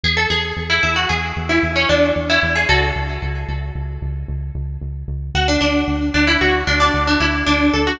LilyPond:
<<
  \new Staff \with { instrumentName = "Pizzicato Strings" } { \time 5/4 \key fis \minor \tempo 4 = 113 gis'16 a'16 gis'8. e'16 e'16 fis'16 gis'8. e'8 cis'16 d'8 r16 e'8 gis'16 | <fis' a'>2 r2. | fis'16 d'16 d'4 d'16 e'16 fis'8 d'16 d'8 d'16 e'8 d'8 a'16 fis'16 | }
  \new Staff \with { instrumentName = "Synth Bass 1" } { \clef bass \time 5/4 \key fis \minor e,8 e,8 e,8 e,8 e,8 e,8 e,8 e,8 e,8 e,8 | cis,8 cis,8 cis,8 cis,8 cis,8 cis,8 cis,8 cis,8 cis,8 cis,8 | d,8 d,8 d,8 d,8 d,8 d,8 d,8 d,8 d,8 d,8 | }
>>